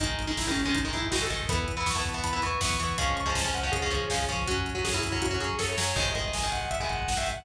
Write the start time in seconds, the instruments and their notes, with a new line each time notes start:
0.00 synth bass 1 G#1, overdriven guitar D#3 G#3, distortion guitar D#4, kick, closed hi-hat
0.09 kick
0.19 synth bass 1 G#1, kick, closed hi-hat
0.27 overdriven guitar D#3 G#3, distortion guitar D#4, kick
0.37 synth bass 1 G#1, distortion guitar E4, kick, snare
0.46 overdriven guitar D#3 G#3, distortion guitar C#4, kick
0.56 synth bass 1 G#1, kick, closed hi-hat
0.65 overdriven guitar D#3 G#3, distortion guitar C#4, kick
0.75 synth bass 1 G#1, distortion guitar D#4, kick, closed hi-hat
0.84 overdriven guitar D#3 G#3, kick
0.93 synth bass 1 G#1, overdriven guitar D#3 G#3, distortion guitar E4, kick, closed hi-hat
1.02 kick
1.11 synth bass 1 G#1, overdriven guitar D#3 G#3, distortion guitar F#4, kick, snare
1.21 distortion guitar A4, kick
1.30 synth bass 1 G#1, overdriven guitar D#3 G#3, kick, closed hi-hat
1.40 kick
1.49 synth bass 1 E2, overdriven guitar E3 B3, distortion guitar B5, kick, closed hi-hat
1.58 kick
1.68 synth bass 1 E2, kick, closed hi-hat
1.77 overdriven guitar E3 B3, distortion guitar B5, kick
1.86 synth bass 1 E2, distortion guitar C#6, kick, snare
1.95 overdriven guitar E3 B3, distortion guitar A5, kick
2.05 synth bass 1 E2, kick, closed hi-hat
2.14 overdriven guitar E3 B3, distortion guitar A5, kick
2.24 synth bass 1 E2, distortion guitar B5, kick, closed hi-hat
2.33 overdriven guitar E3 B3, kick
2.42 synth bass 1 E2, overdriven guitar E3 B3, distortion guitar C#6, kick, closed hi-hat
2.51 kick
2.61 synth bass 1 E2, overdriven guitar E3 B3, distortion guitar C#6, kick, snare
2.70 distortion guitar C#6, kick
2.79 synth bass 1 E2, overdriven guitar E3 B3, kick, closed hi-hat
2.89 kick
2.98 synth bass 1 C#2, overdriven guitar F3 G#3 C#4, distortion guitar C#6, kick, closed hi-hat
3.07 distortion guitar C#6, kick
3.16 synth bass 1 C#2, distortion guitar C#6, kick, closed hi-hat
3.26 overdriven guitar F3 G#3 C#4, distortion guitar A5, kick
3.35 synth bass 1 C#2, distortion guitar A5, kick, snare
3.44 overdriven guitar F3 G#3 C#4, distortion guitar G#5, kick
3.54 synth bass 1 C#2, distortion guitar F#5, kick, closed hi-hat
3.63 overdriven guitar F3 G#3 C#4, kick
3.72 synth bass 1 C#2, distortion guitar G#4, kick, closed hi-hat
3.82 overdriven guitar F3 G#3 C#4, kick
3.90 synth bass 1 C#2, overdriven guitar F3 G#3 C#4, kick, closed hi-hat
4.00 kick
4.10 synth bass 1 C#2, overdriven guitar F3 G#3 C#4, kick, snare
4.19 kick
4.28 synth bass 1 C#2, overdriven guitar F3 G#3 C#4, kick, closed hi-hat
4.38 kick
4.47 synth bass 1 F#2, overdriven guitar F#3 C#4, distortion guitar F#4, kick, closed hi-hat
4.57 kick
4.66 synth bass 1 F#2, kick, closed hi-hat
4.74 overdriven guitar F#3 C#4, distortion guitar F#4, kick
4.84 synth bass 1 F#2, distortion guitar G#4, kick, snare
4.93 overdriven guitar F#3 C#4, distortion guitar E4, kick
5.03 synth bass 1 F#2, kick, closed hi-hat
5.12 overdriven guitar F#3 C#4, distortion guitar E4, kick
5.22 synth bass 1 F#2, distortion guitar F#4, kick, closed hi-hat
5.31 overdriven guitar F#3 C#4, kick
5.40 synth bass 1 F#2, overdriven guitar F#3 C#4, distortion guitar G#4, kick, closed hi-hat
5.50 kick
5.59 synth bass 1 F#2, overdriven guitar F#3 C#4, distortion guitar A4, kick, snare
5.69 distortion guitar C#5
5.77 synth bass 1 F#2, overdriven guitar F#3 C#4, snare
5.96 synth bass 1 G#1, overdriven guitar D#3 G#3, distortion guitar D#5, kick, crash
6.06 kick
6.15 synth bass 1 G#1, overdriven guitar D#3 G#3, kick, closed hi-hat
6.24 distortion guitar D#5, kick
6.33 synth bass 1 G#1, distortion guitar G#5, kick, snare
6.43 overdriven guitar D#3 G#3, kick
6.52 synth bass 1 G#1, distortion guitar F#5, kick, closed hi-hat
6.61 kick
6.71 synth bass 1 G#1, distortion guitar E5, kick, closed hi-hat
6.80 overdriven guitar D#3 G#3, distortion guitar G#5, kick
6.89 synth bass 1 G#1, distortion guitar F#5, kick, closed hi-hat
6.99 kick
7.08 synth bass 1 G#1, distortion guitar F#5, kick, snare
7.17 overdriven guitar D#3 G#3, distortion guitar E5, kick
7.26 synth bass 1 G#1, kick, closed hi-hat
7.36 distortion guitar F#5, kick